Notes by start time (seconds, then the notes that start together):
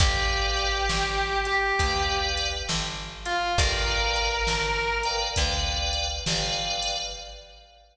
0.00 G1 G4 B4 D5 F5 G5, kick, closed hi-hat
0.57 closed hi-hat
0.89 G1, snare
1.45 G4, closed hi-hat
1.79 D2 B4 D5 F5 G5, kick, closed hi-hat
2.37 closed hi-hat
2.69 G1, snare
3.26 F4, closed hi-hat
3.58 G1 A#4 B4 D5 F5 G5, kick, closed hi-hat
4.16 closed hi-hat
4.47 G1, snare
5.03 B4 D5 F5 G5, closed hi-hat
5.36 D2 B4 D5 F5 G5, kick, closed hi-hat
5.93 closed hi-hat
6.26 G1 B4 D5 F5 G5, snare
6.82 closed hi-hat